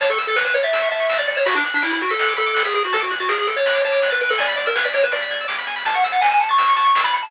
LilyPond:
<<
  \new Staff \with { instrumentName = "Lead 1 (square)" } { \time 4/4 \key a \major \tempo 4 = 164 cis''16 a'16 r16 a'16 b'16 b'16 cis''16 e''8. e''8. d''16 d''16 cis''16 | fis'16 d'16 r16 d'16 e'16 e'16 fis'16 a'8. a'8. gis'16 gis'16 fis'16 | a'16 fis'16 r16 fis'16 gis'16 gis'16 a'16 cis''8. cis''8. b'16 b'16 a'16 | d''8 d''16 ais'16 b'16 d''16 cis''16 b'16 d''4 r4 |
a''16 fis''16 r16 fis''16 gis''16 gis''16 a''16 cis'''8. cis'''8. b''16 b''16 a''16 | }
  \new Staff \with { instrumentName = "Lead 1 (square)" } { \time 4/4 \key a \major a''16 cis'''16 e'''16 a'''16 cis''''16 e''''16 cis''''16 a'''16 e'''16 cis'''16 a''16 cis'''16 e'''16 a'''16 cis''''16 e''''16 | b''16 d'''16 fis'''16 b'''16 d''''16 fis''''16 d''''16 b'''16 fis'''16 d'''16 b''16 d'''16 fis'''16 b'''16 d''''16 fis''''16 | a''16 d'''16 fis'''16 a'''16 d''''16 fis''''16 d''''16 a'''16 fis'''16 d'''16 a''16 d'''16 fis'''16 a'''16 d''''16 fis''''16 | gis''16 b''16 d'''16 e'''16 gis'''16 b'''16 d''''16 e''''16 d''''16 b'''16 gis'''16 e'''16 d'''16 b''16 gis''16 b''16 |
a''16 cis'''16 e'''16 a'''16 cis''''16 e''''16 cis''''16 a'''16 e'''16 cis'''16 a''16 cis'''16 e'''16 a'''16 cis''''16 e''''16 | }
  \new Staff \with { instrumentName = "Synth Bass 1" } { \clef bass \time 4/4 \key a \major a,,8 a,,8 a,,8 a,,8 a,,8 a,,8 a,,8 a,,8 | b,,8 b,,8 b,,8 b,,8 b,,8 b,,8 b,,8 b,,8 | d,8 d,8 d,8 d,8 d,8 d,8 d,8 d,8 | e,8 e,8 e,8 e,8 e,8 e,8 e,8 e,8 |
a,,8 a,,8 a,,8 a,,8 a,,8 a,,8 a,,8 a,,8 | }
  \new DrumStaff \with { instrumentName = "Drums" } \drummode { \time 4/4 <hh bd>16 hh16 hh16 hh16 sn16 hh16 hh16 hh16 <hh bd>16 hh16 hh16 hh16 sn16 hh16 hh16 hh16 | <hh bd>16 hh16 hh16 hh16 sn16 hh16 hh16 hh16 <hh bd>16 hh16 hh16 hh16 sn16 hh16 hh16 hh16 | <hh bd>16 hh16 hh16 <hh bd>16 sn16 hh16 hh16 hh16 <hh bd>16 hh16 hh16 hh16 sn16 hh16 hh16 hho16 | <hh bd>16 hh16 <hh bd>16 hh16 sn16 hh16 hh16 hh16 <hh bd>16 hh16 hh16 hh16 sn16 hh16 hh16 hho16 |
<hh bd>16 hh16 hh16 hh16 sn16 hh16 hh16 hh16 <hh bd>16 hh16 hh16 hh16 sn16 hh16 hh16 hh16 | }
>>